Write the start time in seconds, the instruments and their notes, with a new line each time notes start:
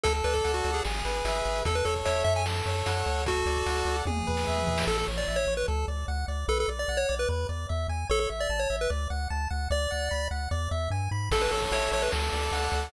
0.03 synth bass 1 D2, lead 1 (square) A4, kick, closed hi-hat
0.14 closed hi-hat
0.24 synth bass 1 D2, lead 1 (square) B4 D5, closed hi-hat
0.33 lead 1 (square) A4, kick, closed hi-hat
0.44 synth bass 1 D2, lead 1 (square) F#5, closed hi-hat
0.54 lead 1 (square) F#4, closed hi-hat
0.64 synth bass 1 D2, lead 1 (square) D5, closed hi-hat
0.74 lead 1 (square) G#4, closed hi-hat
0.85 synth bass 1 G#1, lead 1 (square) G#4, snare
0.95 closed hi-hat
1.05 synth bass 1 G#1, lead 1 (square) B4, closed hi-hat
1.15 closed hi-hat
1.25 synth bass 1 G#1, lead 1 (square) E5, closed hi-hat
1.35 closed hi-hat
1.45 synth bass 1 G#1, lead 1 (square) B4, closed hi-hat
1.55 closed hi-hat
1.65 synth bass 1 E2, lead 1 (square) A4, kick, closed hi-hat
1.75 lead 1 (square) B4, closed hi-hat
1.85 synth bass 1 E2, lead 1 (square) A4 C#5, closed hi-hat
1.96 kick, closed hi-hat
2.05 synth bass 1 E2, lead 1 (square) C#5 E5, closed hi-hat
2.16 closed hi-hat
2.24 synth bass 1 F#2, lead 1 (square) C#5 E5, closed hi-hat
2.36 lead 1 (square) G#5, closed hi-hat
2.46 lead 1 (square) A4, snare
2.55 closed hi-hat
2.66 synth bass 1 F#2, lead 1 (square) C#5, closed hi-hat
2.76 closed hi-hat
2.86 synth bass 1 F#2, lead 1 (square) F#5, closed hi-hat
2.96 closed hi-hat
3.06 synth bass 1 D2, lead 1 (square) C#5, closed hi-hat
3.16 open hi-hat
3.26 lead 1 (square) F#4 A4, kick, closed hi-hat
3.36 closed hi-hat
3.46 synth bass 1 D2, lead 1 (square) D5, closed hi-hat
3.56 kick, closed hi-hat
3.66 synth bass 1 D2, lead 1 (square) F#5, closed hi-hat
3.77 closed hi-hat
3.85 synth bass 1 D2, lead 1 (square) D5, closed hi-hat
3.97 closed hi-hat
4.05 synth bass 1 E2, lead 1 (square) G#4, kick, high tom
4.17 mid tom
4.27 synth bass 1 E2, lead 1 (square) B4, floor tom
4.37 snare
4.47 synth bass 1 E2, lead 1 (square) E5
4.57 mid tom
4.67 synth bass 1 E2, lead 1 (square) B4, floor tom
4.78 snare
4.87 synth bass 1 A1, lead 1 (square) A4
4.98 lead 1 (square) A4
5.08 synth bass 1 A1, lead 1 (square) C#5
5.18 lead 1 (square) D5
5.28 synth bass 1 A1, lead 1 (square) E5
5.36 lead 1 (square) C#5
5.47 synth bass 1 A1, lead 1 (square) C#5
5.57 lead 1 (square) B4
5.68 synth bass 1 D2, lead 1 (square) A4
5.88 synth bass 1 D2, lead 1 (square) D5
6.08 synth bass 1 D2, lead 1 (square) F#5
6.28 synth bass 1 D2, lead 1 (square) D5
6.48 synth bass 1 B1, lead 1 (square) A4 B4
6.60 lead 1 (square) A4
6.68 synth bass 1 B1, lead 1 (square) D5
6.79 lead 1 (square) D5
6.88 synth bass 1 B1, lead 1 (square) F#5
6.97 lead 1 (square) C#5
7.09 synth bass 1 B1, lead 1 (square) D5
7.19 lead 1 (square) B4
7.29 synth bass 1 E2, lead 1 (square) B4
7.49 synth bass 1 E2, lead 1 (square) D5
7.69 synth bass 1 E2, lead 1 (square) E5
7.88 synth bass 1 E2, lead 1 (square) G#5
8.09 synth bass 1 A1, lead 1 (square) A4 C#5
8.20 lead 1 (square) A4
8.30 synth bass 1 A1, lead 1 (square) E5
8.40 lead 1 (square) D5
8.49 synth bass 1 A1, lead 1 (square) A5
8.59 lead 1 (square) C#5
8.70 synth bass 1 A1, lead 1 (square) E5
8.81 lead 1 (square) B4
8.90 synth bass 1 D2, lead 1 (square) D5
9.10 synth bass 1 D2, lead 1 (square) F#5
9.30 synth bass 1 D2, lead 1 (square) A5
9.50 synth bass 1 D2, lead 1 (square) F#5
9.70 synth bass 1 D2, lead 1 (square) D5
9.91 synth bass 1 D2, lead 1 (square) F#5
10.11 synth bass 1 D2, lead 1 (square) B5
10.31 synth bass 1 D2, lead 1 (square) F#5
10.51 synth bass 1 E2, lead 1 (square) D5
10.71 synth bass 1 E2, lead 1 (square) E5
10.90 synth bass 1 G2, lead 1 (square) G#5
11.11 synth bass 1 G#2, lead 1 (square) B5
11.31 synth bass 1 A1, lead 1 (square) A4, kick, crash
11.41 lead 1 (square) B4, closed hi-hat
11.51 synth bass 1 A1, lead 1 (square) A4 C#5, closed hi-hat
11.62 kick, closed hi-hat
11.71 synth bass 1 A1, lead 1 (square) C#5 E5, closed hi-hat
11.82 closed hi-hat
11.91 synth bass 1 A1, lead 1 (square) C#5, closed hi-hat
12.02 lead 1 (square) B4, closed hi-hat
12.12 synth bass 1 D2, lead 1 (square) A4, snare
12.22 closed hi-hat
12.32 synth bass 1 D2, lead 1 (square) D5, closed hi-hat
12.42 closed hi-hat
12.52 synth bass 1 D2, lead 1 (square) F#5, closed hi-hat
12.62 closed hi-hat
12.72 synth bass 1 D2, lead 1 (square) D5, closed hi-hat
12.83 closed hi-hat